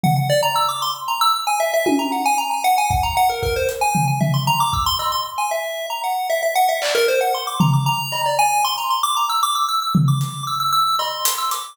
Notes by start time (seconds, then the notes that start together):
0.03 F#5, floor tom
0.17 F#5
0.30 D5
0.43 A#5
0.56 E6
0.68 D6
0.82 C6
1.08 A#5
1.21 E6
1.34 E6
1.47 G#5
1.60 E5
1.74 E5
1.86 G#5, high tom
1.99 A#5
2.12 F#5
2.26 G#5
2.38 A#5
2.51 G#5
2.64 F#5
2.78 G#5
2.90 F#5, kick
3.03 A#5
3.17 F#5
3.29 A#4
3.43 A#4, kick
3.56 C5
3.69 closed hi-hat
3.81 G#5
3.95 floor tom
4.08 G#5
4.20 E5, floor tom
4.34 C6
4.47 A#5, floor tom
4.60 D6
4.73 E6, kick
4.86 C6
4.99 E6, cowbell
5.12 C6
5.38 G#5
5.51 E5
5.90 A#5
6.04 F#5
6.30 E5
6.43 E5
6.55 F#5
6.69 E5
6.82 D5, clap
6.95 A#4
7.08 C5
7.21 F#5
7.34 C6
7.47 D6
7.60 A#5, floor tom
7.73 D6
7.86 A#5
8.12 cowbell
8.26 D5
8.39 G#5
8.64 C6
8.78 A#5
8.90 C6
9.03 D6
9.17 A#5
9.29 E6
9.43 D6
9.55 E6
9.68 E6
9.82 E6
9.95 floor tom
10.08 D6
10.21 closed hi-hat
10.47 E6
10.60 E6
10.72 E6
10.99 C6, cowbell
11.25 closed hi-hat
11.38 E6
11.51 D6, closed hi-hat